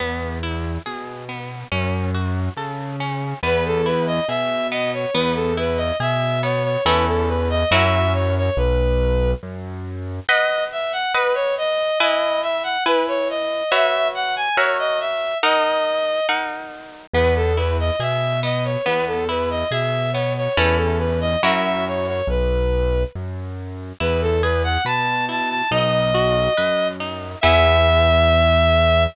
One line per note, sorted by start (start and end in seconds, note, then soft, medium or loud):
0.00 0.78 E2 medium
0.00 0.39 B3 medium
0.43 0.81 E4 medium
0.86 1.64 B2 medium
0.86 1.24 G#4 medium
1.29 1.67 B3 medium
1.71 2.49 F#2 medium
1.71 2.10 C#4 medium
2.14 2.53 F#4 medium
2.57 3.34 C#3 medium
2.57 2.96 A4 medium
3.00 3.39 C#4 medium
3.43 4.20 E2 loud
3.43 3.81 B3 loud
3.43 3.64 B4 medium
3.66 3.86 A4 medium
3.86 4.24 E4 medium
3.86 4.06 B4 medium
4.07 4.27 D#5 medium
4.28 5.06 B2 medium
4.28 4.67 G#4 medium
4.28 4.67 E5 medium
4.71 5.10 B3 medium
4.71 4.91 D#5 medium
4.93 5.14 C#5 medium
5.14 5.92 E2 loud
5.14 5.53 B3 loud
5.14 5.34 B4 medium
5.35 5.55 A4 medium
5.57 5.96 E4 medium
5.57 5.79 B4 medium
5.77 5.97 D#5 medium
6.00 6.77 B2 medium
6.00 6.39 G#4 medium
6.00 6.41 E5 medium
6.43 6.81 B3 medium
6.43 6.63 C#5 medium
6.64 6.84 C#5 medium
6.85 7.64 E2 loud
6.85 7.63 C#4 loud
6.85 7.63 E4 loud
6.85 7.63 A4 medium
6.85 7.05 B4 medium
7.08 7.28 A4 medium
7.28 7.49 B4 medium
7.50 7.70 D#5 medium
7.71 8.50 F#2 loud
7.71 8.49 C#4 loud
7.71 8.49 E4 medium
7.71 8.49 F#4 loud
7.71 8.49 A#4 loud
7.71 8.13 E5 medium
8.14 8.34 C#5 medium
8.37 8.58 C#5 medium
8.57 9.34 B1 loud
8.57 9.31 B4 medium
9.43 10.20 F#2 medium
10.29 11.06 B4 loud
10.29 10.64 D#5 medium
10.29 11.06 D#5 loud
10.29 11.06 F#5 loud
10.72 10.92 E5 medium
10.92 11.13 F#5 medium
11.14 11.34 B4 medium
11.14 11.91 B4 loud
11.14 11.91 D#5 loud
11.14 11.91 F#5 medium
11.34 11.55 C#5 medium
11.58 11.99 D#5 medium
12.00 12.77 E4 loud
12.00 12.77 B4 loud
12.00 12.41 D#5 medium
12.00 12.77 G#5 loud
12.42 12.63 E5 medium
12.63 12.84 F#5 medium
12.85 13.63 E4 loud
12.85 13.06 B4 medium
12.85 13.63 B4 loud
12.85 13.63 G#5 medium
13.08 13.28 C#5 medium
13.30 13.71 D#5 medium
13.71 14.49 F#4 loud
13.71 14.49 B4 loud
13.71 14.49 C#5 loud
13.71 14.08 E5 medium
13.71 14.49 E5 loud
14.15 14.35 F#5 medium
14.36 14.56 G#5 medium
14.56 15.34 F#4 loud
14.56 15.34 A#4 loud
14.56 14.77 C#5 medium
14.56 15.34 C#5 loud
14.56 15.34 E5 loud
14.79 14.99 D#5 medium
15.00 15.38 E5 medium
15.43 16.20 D#4 loud
15.43 16.20 A#4 loud
15.43 16.27 D#5 medium
15.43 16.20 F#5 loud
16.29 17.06 D#4 loud
16.29 17.06 A#4 medium
16.29 17.06 F#5 medium
17.14 17.91 E2 loud
17.14 17.53 B3 medium
17.14 17.34 B4 medium
17.36 17.56 A4 medium
17.57 17.96 E4 medium
17.57 17.77 B4 medium
17.80 18.00 D#5 medium
18.00 18.77 B2 medium
18.00 18.39 G#4 medium
18.00 18.40 E5 medium
18.43 18.81 B3 medium
18.43 18.64 D#5 medium
18.64 18.85 C#5 medium
18.84 19.64 E2 medium
18.84 19.24 B3 loud
18.84 19.05 B4 medium
19.07 19.27 A4 medium
19.29 19.67 E4 medium
19.29 19.49 B4 medium
19.50 19.71 D#5 medium
19.71 20.48 B2 medium
19.71 20.10 G#4 medium
19.71 20.11 E5 medium
20.13 20.53 B3 medium
20.13 20.33 C#5 medium
20.37 20.57 C#5 medium
20.56 21.36 E2 loud
20.56 21.34 C#4 loud
20.56 21.34 E4 loud
20.56 21.34 A4 medium
20.56 20.77 B4 medium
20.77 20.98 A4 medium
20.99 21.19 B4 medium
21.21 21.41 D#5 medium
21.43 22.22 F#2 medium
21.43 22.20 C#4 medium
21.43 22.20 E4 medium
21.43 22.20 F#4 medium
21.43 22.20 A#4 medium
21.43 21.85 E5 medium
21.87 22.07 C#5 medium
22.07 22.28 C#5 medium
22.27 23.04 B1 medium
22.27 23.03 B4 medium
23.15 23.93 F#2 medium
24.00 24.78 E2 loud
24.00 24.39 E4 medium
24.00 24.21 B4 medium
24.22 24.42 A4 medium
24.42 24.81 G#4 medium
24.42 24.62 B4 medium
24.64 24.84 F#5 medium
24.85 25.62 B2 medium
24.85 25.24 B4 medium
24.85 25.25 A5 medium
25.29 25.67 E4 medium
25.29 25.49 A5 medium
25.50 25.70 A5 medium
25.71 26.48 B1 loud
25.71 26.10 D#4 medium
25.71 26.88 D#5 medium
26.14 26.53 F#4 medium
26.57 27.35 F#2 medium
26.57 26.96 B4 medium
27.00 27.39 D#4 medium
27.41 29.06 E2 loud
27.41 29.05 B3 loud
27.41 29.05 E4 medium
27.41 29.05 G#4 medium
27.41 29.04 E5 loud